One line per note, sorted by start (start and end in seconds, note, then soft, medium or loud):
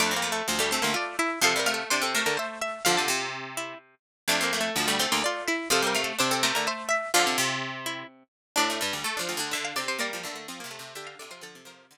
0.00 0.42 F2 medium
0.00 0.14 A3 medium
0.00 0.12 D4 medium
0.00 0.63 D6 medium
0.11 0.22 C4 medium
0.16 0.31 A#3 medium
0.22 0.41 A3 medium
0.32 0.47 A3 medium
0.48 0.79 D2 medium
0.48 0.59 F3 medium
0.59 0.70 G3 medium
0.59 0.71 A3 medium
0.71 1.31 A3 medium
0.71 0.83 C4 medium
0.71 0.82 C6 medium
0.82 0.95 D2 medium
0.82 0.93 A#3 medium
0.82 0.94 C6 loud
0.94 1.16 F4 medium
0.94 1.16 D5 loud
1.19 1.39 E4 medium
1.19 1.40 E5 loud
1.41 1.84 C3 medium
1.41 1.53 F3 medium
1.41 1.60 A4 medium
1.41 1.66 F5 loud
1.56 1.67 G3 medium
1.56 1.74 A#4 medium
1.66 1.89 A3 medium
1.66 1.87 F5 medium
1.74 1.89 A4 medium
1.90 2.23 C3 medium
1.90 2.02 D4 medium
1.90 2.12 C5 loud
2.02 2.13 C4 medium
2.02 2.14 A4 medium
2.15 2.79 A3 medium
2.15 2.34 A#4 medium
2.15 2.26 C5 medium
2.26 2.37 D3 medium
2.26 2.37 A#4 medium
2.37 2.59 C5 medium
2.37 2.60 E5 medium
2.61 2.82 E5 medium
2.61 2.85 E5 medium
2.85 3.08 D3 medium
2.85 2.97 F3 medium
2.85 3.29 F4 medium
2.85 2.96 F5 loud
2.97 3.95 C3 medium
2.97 3.76 A5 medium
3.08 3.74 C3 medium
3.57 3.78 E4 medium
4.28 4.70 F2 medium
4.28 4.44 A3 medium
4.28 4.41 D4 medium
4.28 4.92 D6 loud
4.41 4.59 A#3 medium
4.41 4.52 C4 medium
4.53 4.72 A3 medium
4.61 4.76 A3 medium
4.76 5.06 D2 medium
4.76 4.88 F3 medium
4.88 4.99 G3 medium
4.88 4.99 A3 medium
4.99 5.58 A3 medium
4.99 5.11 C4 medium
4.99 5.11 C6 loud
5.12 5.23 D2 medium
5.12 5.23 A#3 medium
5.12 5.23 C6 loud
5.24 5.48 F4 medium
5.24 5.44 D5 loud
5.48 5.69 E4 medium
5.48 5.69 E5 loud
5.70 6.13 C3 medium
5.70 5.81 F3 medium
5.70 5.87 A4 medium
5.70 5.95 F5 loud
5.82 5.94 G3 medium
5.87 6.02 A#4 medium
5.94 6.17 A3 medium
5.94 6.16 F5 loud
6.04 6.19 A4 medium
6.19 6.52 C3 medium
6.19 6.30 D4 medium
6.19 6.41 C5 loud
6.31 6.42 C4 medium
6.31 6.43 A4 medium
6.43 7.08 A3 medium
6.43 6.62 A#4 loud
6.43 6.55 C5 medium
6.55 6.67 D3 medium
6.55 6.66 A#4 medium
6.67 6.89 C5 medium
6.67 6.88 E5 medium
6.89 7.12 E5 medium
6.89 7.11 E5 loud
7.14 7.37 D3 medium
7.14 7.25 F3 medium
7.14 7.57 F4 medium
7.14 7.26 F5 loud
7.26 8.23 C3 medium
7.26 8.05 A5 medium
7.38 8.03 C3 medium
7.86 8.07 E4 medium
8.56 8.80 A2 medium
8.56 8.99 D4 medium
8.56 8.69 D4 medium
8.56 9.36 D5 loud
8.70 8.81 A3 medium
8.81 8.93 G2 medium
8.81 9.03 G3 medium
8.93 9.04 D2 medium
9.04 9.19 A3 medium
9.17 9.34 F3 medium
9.17 9.28 D4 medium
9.29 9.51 D2 medium
9.29 9.40 F4 medium
9.37 9.52 D3 medium
9.37 9.74 D4 medium
9.51 9.86 D3 medium
9.51 9.73 D3 medium
9.51 9.64 E5 medium
9.65 9.76 F5 loud
9.76 9.98 C3 medium
9.76 9.97 C4 medium
9.76 9.88 D5 medium
9.88 10.00 C3 medium
9.88 9.99 C5 loud
9.99 10.22 G3 medium
9.99 10.10 A#3 medium
9.99 10.45 A#3 medium
9.99 10.83 D5 loud
10.13 10.24 F3 medium
10.23 10.47 D3 medium
10.23 10.35 A3 medium
10.36 10.47 A3 medium
10.48 10.63 F3 medium
10.48 10.60 C4 medium
10.60 10.79 C3 medium
10.60 10.71 A#3 medium
10.71 10.93 A3 medium
10.79 10.94 C3 medium
10.95 11.15 D3 medium
10.95 11.27 D3 medium
10.95 11.17 G4 medium
10.95 11.07 E5 medium
11.07 11.18 F5 loud
11.19 11.43 C3 medium
11.19 11.31 A4 medium
11.19 11.31 D5 medium
11.31 11.42 F3 medium
11.31 11.42 F4 medium
11.31 11.42 C5 medium
11.41 11.55 D3 medium
11.41 11.61 F3 medium
11.41 11.83 A4 medium
11.41 11.63 A4 loud
11.55 11.98 C3 medium
11.65 11.86 F3 medium
11.65 11.98 A#4 loud
11.91 11.98 D3 medium